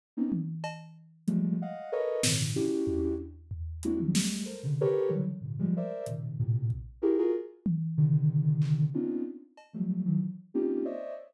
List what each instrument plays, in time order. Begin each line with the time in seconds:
0.17 ocarina A#3 B3 C4 C#4 D#4
0.32 high tom
0.64 cowbell
1.27 ocarina F3 G3 G#3 A3, closed hi-hat
1.62 ocarina D#5 F5 F#5
1.92 ocarina A4 A#4 B4 C#5 D#5
2.23 ocarina G#2 A#2 C3 C#3 D#3 E3, snare
2.55 ocarina C#4 D4 E4 F#4 G4
2.87 floor tom
3.51 floor tom
3.83 ocarina G#3 A#3 C4 D4 E4 F#4, closed hi-hat
4.00 ocarina D#3 F3 F#3 G3
4.14 ocarina G3 G#3 A3, snare
4.46 ocarina A4 A#4 C5
4.63 ocarina C3 C#3 D3
4.81 ocarina G4 A4 A#4 B4 C#5
5.09 ocarina C#3 D3 E3 F#3 G3
5.41 ocarina G#2 A#2 C3 D3
5.59 ocarina F3 G3 G#3
5.77 ocarina A#4 C5 D5 E5
6.06 ocarina A#2 B2 C3 C#3 D#3, closed hi-hat
6.39 ocarina A2 A#2 C3
6.70 kick
7.02 ocarina E4 F#4 G4 G#4 A#4
7.18 ocarina F4 F#4 G#4 A#4
7.66 high tom
7.97 ocarina C3 D3 D#3
8.62 clap
8.94 ocarina B3 C4 C#4 D4 D#4 F4
9.57 cowbell
9.73 ocarina F3 F#3 G3 A3
10.05 ocarina D#3 E3 F#3
10.54 ocarina A#3 C4 C#4 D#4 F4 G4
10.85 ocarina C5 C#5 D5 D#5 E5